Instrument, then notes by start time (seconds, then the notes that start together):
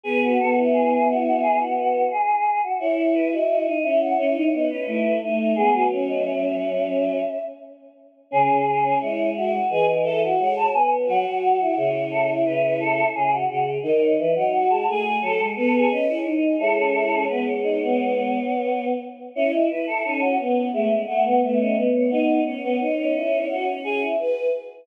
choir aahs
0.04 B3 G#4 B4
0.23 F#4
0.38 B3 F#4 A4
0.56 E4
0.73 G#4
0.91 G#4
1.08 F#4
1.25 F#4
1.42 G#4
1.60 F#4
1.77 F#4
2.11 G#4
2.63 F#4
2.79 E4 C#5
2.98 C#5
3.14 B4
3.32 F#4 D#5
3.49 F#4 D#5
3.66 D#4 D#5
3.83 C#4 E4 E5
4.01 F#5
4.18 C#4 C#5
4.35 D#4
4.53 B3 D#4
4.70 C#4 B4
4.87 A3 E4
5.22 A3 D#4
5.39 D#4
5.56 G#3 B3 G#4
5.73 F#3
5.91 C#4
6.08 D#5
6.25 E5
8.31 C#3 C#4 G#4
8.49 C#3 G#4
8.66 G#4
8.83 C#4
9.00 G#3 E4 C#5
9.35 F#4 E5
9.69 E3 G#4 D#5
9.87 D#5
10.04 A4 E5
10.23 F#4
10.39 G#3 C#5 F#5
10.56 A5
10.73 B3 G#5
11.06 F#3 F#4 F#5
11.25 F#3 F#5
11.42 F#5
11.59 E4
11.77 C#3 C#5
12.11 A4
12.46 C#3 B4
12.63 B4
12.80 A4
13.15 C#3 G#4
13.32 F#4
13.49 C#3 F#4
13.83 D#3 D#4 D#5
14.01 C#5
14.18 E3 E5
14.35 F#3 D#4 F#5
14.53 F#4 F#5
14.70 G#3 A5
14.87 A3 G#4
15.21 F#3 A4
15.39 G#3
15.56 B3 A4 B4
15.73 G#4 A4
15.90 C#4 B4 D#5
16.08 E4 C#5
16.25 D#4
16.42 D#5
16.59 G#3 E4 A4 C#5
16.76 C#4
16.94 E4
17.11 C#4
17.28 B3 B4
17.46 C#5
17.63 D#4
17.80 B3
19.35 C#4 E4 C#5
19.52 E4 D#5
19.70 E4 B4
19.87 E4 A4
20.04 C#4 D#4 A4
20.21 C#4 F#4
20.39 B3
20.73 G#3 A3 E5
21.07 A3 F#5
21.24 B3 F#5
21.42 A3 B3 E5
21.59 C#4 D#5
21.77 B3
21.94 B3 C#5
22.10 B3 D#4 D#5
22.45 C#4 C#5
22.64 B3
22.80 D#4
22.98 C#4
23.14 E4
23.49 F#4
23.84 G#4
24.00 E4
24.18 B4